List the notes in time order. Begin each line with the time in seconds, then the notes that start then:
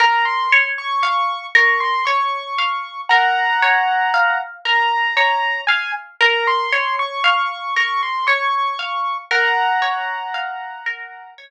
0.00 A#4 A#5
0.25 C6
0.52 C#5
0.78 C#6
1.03 F5 C#6
1.55 A#4 C#6
1.80 C6
2.05 C#5 C#6
2.58 F5
3.09 A#4 F#5 A#5
3.62 C#5
4.14 F5
4.65 A#4 A#5
5.17 C#5 A#5
5.67 F5 G#5
6.21 A#4 A#5
6.47 C6
6.72 C#5
6.99 C#6
7.24 F5 C#6
7.76 A#4 C#6
8.03 C6
8.27 C#5 C#6
8.79 F5
9.31 A#4 F#5 A#5
9.82 C#5
10.34 F5
10.86 A#4
11.38 C#5